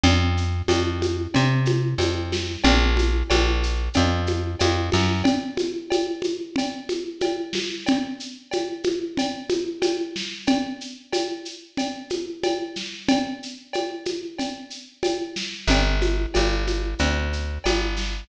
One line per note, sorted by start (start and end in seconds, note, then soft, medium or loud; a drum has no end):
0.03 0.62 F2 loud
0.03 cowbell medium
0.03 low conga medium
0.03 shaker medium
0.37 shaker medium
0.68 1.27 F2 medium
0.68 cowbell medium
0.68 high conga medium
0.68 shaker medium
1.02 high conga medium
1.02 shaker medium
1.34 1.94 C3 medium
1.34 cowbell medium
1.34 low conga medium
1.34 shaker medium
1.65 high conga medium
1.65 shaker medium
1.98 2.57 F2 medium
1.98 cowbell medium
1.98 high conga medium
1.98 shaker medium
2.32 snare medium
2.32 high conga medium
2.32 shaker medium
2.64 3.23 A#1 loud
2.64 cowbell medium
2.64 low conga medium
2.64 shaker medium
2.97 high conga medium
2.97 shaker medium
3.30 3.89 A#1 medium
3.30 cowbell medium
3.30 high conga medium
3.30 shaker medium
3.63 shaker medium
3.94 4.55 F2 medium
3.94 cowbell medium
3.94 low conga medium
3.94 shaker medium
4.26 high conga medium
4.26 shaker medium
4.59 4.90 F2 medium
4.59 cowbell medium
4.59 high conga medium
4.59 shaker medium
4.92 5.23 F#2 medium
4.92 snare soft
4.92 high conga medium
4.92 shaker medium
5.24 cowbell medium
5.24 low conga medium
5.24 shaker medium
5.57 high conga medium
5.57 shaker medium
5.90 cowbell medium
5.90 high conga medium
5.90 shaker medium
6.22 high conga medium
6.22 shaker medium
6.56 cowbell medium
6.56 low conga medium
6.56 shaker medium
6.89 high conga medium
6.89 shaker medium
7.21 cowbell medium
7.21 high conga medium
7.21 shaker medium
7.53 snare medium
7.53 high conga medium
7.53 shaker medium
7.86 cowbell medium
7.86 low conga medium
7.86 shaker medium
8.20 shaker medium
8.51 cowbell medium
8.51 high conga medium
8.51 shaker medium
8.84 high conga medium
8.84 shaker medium
9.17 cowbell medium
9.17 low conga medium
9.17 shaker medium
9.49 high conga medium
9.49 shaker medium
9.82 cowbell medium
9.82 high conga medium
9.82 shaker medium
10.16 snare medium
10.16 shaker medium
10.47 cowbell medium
10.47 low conga medium
10.47 shaker medium
10.81 shaker medium
11.13 cowbell medium
11.13 high conga medium
11.13 shaker medium
11.45 shaker medium
11.77 cowbell medium
11.77 low conga medium
11.77 shaker medium
12.10 high conga medium
12.10 shaker medium
12.43 cowbell medium
12.43 high conga medium
12.43 shaker medium
12.76 snare soft
12.76 shaker medium
13.08 cowbell medium
13.08 low conga medium
13.08 shaker medium
13.43 shaker medium
13.73 cowbell medium
13.73 high conga medium
13.73 shaker medium
14.05 high conga medium
14.05 shaker medium
14.38 cowbell medium
14.38 low conga medium
14.38 shaker medium
14.70 shaker medium
15.03 cowbell medium
15.03 high conga medium
15.03 shaker medium
15.36 snare medium
15.36 shaker medium
15.67 16.26 G1 medium
15.67 cowbell medium
15.67 low conga medium
15.67 shaker medium
16.01 high conga medium
16.01 shaker medium
16.34 16.95 G1 medium
16.34 cowbell medium
16.34 high conga medium
16.34 shaker medium
16.67 high conga medium
16.67 shaker medium
16.99 17.58 D2 medium
16.99 cowbell medium
16.99 low conga medium
16.99 shaker medium
17.33 shaker medium
17.64 18.24 G1 medium
17.64 cowbell medium
17.64 high conga medium
17.64 shaker medium
17.96 snare soft
17.96 shaker medium